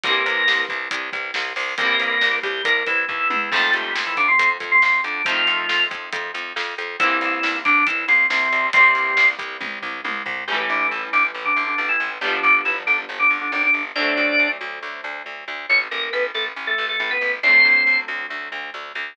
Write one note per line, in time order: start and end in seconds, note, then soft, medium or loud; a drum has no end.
0.04 0.23 C2 loud
0.04 0.63 A#3 medium
0.04 1.61 A#3 medium
0.04 1.61 C4 medium
0.04 0.63 A#4 loud
0.04 kick loud
0.04 closed hi-hat loud
0.08 1.61 E3 medium
0.08 1.61 G3 medium
0.26 0.44 C2 medium
0.26 closed hi-hat medium
0.48 0.66 C2 loud
0.48 snare loud
0.69 0.88 C2 medium
0.69 kick medium
0.69 closed hi-hat medium
0.91 1.10 C2 medium
0.91 kick medium
0.91 closed hi-hat loud
1.13 1.31 C2 medium
1.13 kick medium
1.13 closed hi-hat medium
1.34 1.53 C2 medium
1.34 snare loud
1.56 1.75 C2 medium
1.56 open hi-hat medium
1.78 1.97 C2 loud
1.78 2.36 A#3 medium
1.78 3.35 A#3 medium
1.78 3.35 C4 medium
1.78 2.36 A#4 loud
1.78 kick medium
1.78 closed hi-hat medium
1.83 3.35 E3 loud
1.83 3.35 G3 medium
2.00 2.18 C2 medium
2.00 closed hi-hat medium
2.21 2.40 C2 medium
2.21 snare medium
2.43 2.62 C2 medium
2.43 2.63 G3 medium
2.43 2.63 G4 medium
2.43 kick medium
2.43 closed hi-hat medium
2.64 2.84 C2 medium
2.64 2.85 A#3 medium
2.64 2.85 A#4 loud
2.64 kick medium
2.64 closed hi-hat loud
2.87 3.05 C2 medium
2.87 3.05 E3 medium
2.87 3.05 E4 loud
2.87 kick medium
2.87 closed hi-hat medium
3.08 3.28 D#2 medium
3.08 3.50 E3 medium
3.08 3.50 E4 medium
3.08 kick medium
3.08 floor tom medium
3.30 3.50 E2 medium
3.30 high tom loud
3.52 3.71 F2 medium
3.52 5.08 F3 medium
3.52 3.71 A3 loud
3.52 5.08 A3 loud
3.52 5.08 C4 medium
3.52 3.71 A4 loud
3.52 kick loud
3.52 crash loud
3.57 5.08 D#3 medium
3.74 3.92 F2 medium
3.74 3.93 G3 medium
3.74 3.93 G4 medium
3.74 closed hi-hat medium
3.96 4.14 F2 medium
3.96 snare loud
4.06 4.17 E3 medium
4.06 4.17 E4 medium
4.17 4.36 F2 medium
4.17 4.28 D3 medium
4.17 4.28 D4 loud
4.17 kick medium
4.17 closed hi-hat medium
4.28 4.49 C3 medium
4.28 4.49 C4 medium
4.39 4.58 F2 medium
4.39 kick medium
4.39 closed hi-hat loud
4.60 4.79 F2 medium
4.60 kick medium
4.60 closed hi-hat medium
4.72 4.82 C3 medium
4.72 4.82 C4 medium
4.82 5.01 F2 medium
4.82 5.01 C3 medium
4.82 5.01 C4 medium
4.82 snare medium
5.04 5.22 F2 medium
5.04 5.22 D3 medium
5.04 5.22 D4 medium
5.04 closed hi-hat medium
5.25 5.44 F2 loud
5.25 5.85 F3 medium
5.25 6.82 A3 medium
5.25 6.82 C4 medium
5.25 5.85 F4 loud
5.25 kick loud
5.25 closed hi-hat loud
5.30 6.82 D#3 medium
5.30 6.82 F3 medium
5.47 5.66 F2 medium
5.47 closed hi-hat medium
5.69 5.88 F2 medium
5.69 snare loud
5.91 6.09 F2 medium
5.91 kick medium
5.91 closed hi-hat medium
6.13 6.31 F2 loud
6.13 kick medium
6.13 closed hi-hat loud
6.35 6.53 F2 medium
6.35 closed hi-hat medium
6.56 6.75 F2 loud
6.56 snare medium
6.78 6.97 F2 medium
6.78 closed hi-hat medium
7.00 7.18 C2 loud
7.00 7.56 E3 loud
7.00 8.58 A#3 medium
7.00 8.58 C4 medium
7.00 7.56 E4 loud
7.00 kick loud
7.00 closed hi-hat loud
7.05 8.58 E3 medium
7.05 8.58 G3 medium
7.21 7.40 C2 medium
7.21 closed hi-hat medium
7.43 7.62 C2 medium
7.43 snare loud
7.65 7.84 C2 medium
7.65 7.84 D3 medium
7.65 7.84 D4 loud
7.65 kick medium
7.65 closed hi-hat medium
7.87 8.05 C2 medium
7.87 8.04 E3 medium
7.87 8.04 E4 medium
7.87 kick medium
7.87 closed hi-hat loud
8.08 8.27 C2 medium
8.08 8.27 C3 medium
8.08 8.27 C4 medium
8.08 closed hi-hat medium
8.30 8.49 C2 medium
8.30 8.66 C3 medium
8.30 8.66 C4 loud
8.30 snare loud
8.52 8.71 C2 medium
8.52 closed hi-hat medium
8.73 8.92 C2 medium
8.73 9.26 C3 loud
8.73 10.31 A#3 medium
8.73 9.26 C4 loud
8.73 10.31 C4 medium
8.73 kick loud
8.73 closed hi-hat loud
8.78 10.31 E3 medium
8.78 10.31 G3 medium
8.95 9.14 C2 medium
8.95 closed hi-hat medium
9.17 9.35 C2 medium
9.17 snare loud
9.39 9.57 C2 medium
9.39 kick medium
9.39 closed hi-hat medium
9.61 9.79 C2 medium
9.61 kick medium
9.61 high tom medium
9.82 10.01 C2 medium
9.82 floor tom medium
10.04 10.23 C2 medium
10.04 high tom medium
10.26 10.44 C2 medium
10.26 floor tom loud
10.48 10.66 A1 medium
10.48 10.58 G3 medium
10.48 12.05 A3 medium
10.48 12.05 C#4 medium
10.48 10.58 G4 loud
10.52 12.05 E3 medium
10.52 12.05 G3 medium
10.69 10.88 A1 medium
10.69 10.87 D3 medium
10.69 10.87 D4 medium
10.91 11.10 A1 medium
10.91 11.02 E3 medium
10.91 11.02 E4 medium
11.13 11.32 A1 medium
11.13 11.23 D3 medium
11.13 11.23 D4 loud
11.34 11.53 A1 medium
11.45 11.64 D3 medium
11.45 11.64 D4 loud
11.56 11.75 A1 medium
11.67 11.78 D3 medium
11.67 11.78 D4 loud
11.78 11.97 A1 medium
11.78 11.88 D3 medium
11.78 11.88 D4 medium
11.89 12.10 E3 medium
11.89 12.10 E4 medium
12.00 12.19 A1 medium
12.21 12.40 G1 medium
12.21 12.32 G3 medium
12.21 13.78 B3 medium
12.21 13.78 D4 medium
12.21 12.32 G4 loud
12.25 13.78 F3 medium
12.25 13.78 G3 medium
12.43 12.62 G1 medium
12.43 12.61 D3 medium
12.43 12.61 D4 loud
12.65 12.84 G1 medium
12.65 12.75 E3 medium
12.65 12.75 E4 loud
12.87 13.06 G1 medium
12.87 12.97 D3 medium
12.87 12.97 D4 loud
13.09 13.27 G1 medium
13.19 13.38 D3 medium
13.19 13.38 D4 medium
13.30 13.49 G1 medium
13.41 13.51 D3 medium
13.41 13.51 D4 medium
13.52 13.71 G#1 medium
13.52 13.62 D3 medium
13.52 13.62 D4 loud
13.63 13.82 D3 medium
13.63 13.82 D4 medium
13.74 13.92 G1 medium
13.95 14.14 D2 medium
13.95 15.53 C4 medium
13.95 14.48 D4 loud
13.95 15.53 D4 medium
13.95 14.48 D5 loud
14.00 15.53 F#3 medium
14.00 15.53 A3 medium
14.17 14.36 D2 medium
14.39 14.58 D2 medium
14.61 14.79 D2 medium
14.83 15.01 D2 medium
15.04 15.22 D2 medium
15.26 15.44 D2 medium
15.48 15.66 D2 medium
15.69 15.88 A1 medium
15.69 15.80 C#4 loud
15.69 15.80 C#5 loud
15.91 16.10 A1 medium
15.91 16.09 A#3 medium
15.91 16.09 A#4 medium
16.13 16.32 A1 medium
16.13 16.23 B3 medium
16.13 16.23 B4 loud
16.35 16.53 A1 medium
16.35 16.45 A3 medium
16.35 16.45 A4 loud
16.56 16.75 A1 medium
16.67 16.85 A3 medium
16.67 16.85 A4 loud
16.78 16.97 A1 medium
16.89 16.99 A3 medium
16.89 16.99 A4 medium
17.00 17.18 A1 medium
17.00 17.10 A3 medium
17.00 17.10 A4 loud
17.11 17.32 B3 medium
17.11 17.32 B4 loud
17.21 17.40 A1 medium
17.43 17.62 D2 loud
17.43 17.97 C4 loud
17.43 19.01 C4 medium
17.43 19.01 D4 medium
17.43 17.97 C5 loud
17.48 19.01 F#3 medium
17.48 19.01 A3 medium
17.65 17.83 D2 medium
17.87 18.05 D2 medium
18.08 18.27 D2 medium
18.30 18.49 D2 medium
18.52 18.70 D2 medium
18.74 18.92 D2 medium
18.95 19.14 D2 medium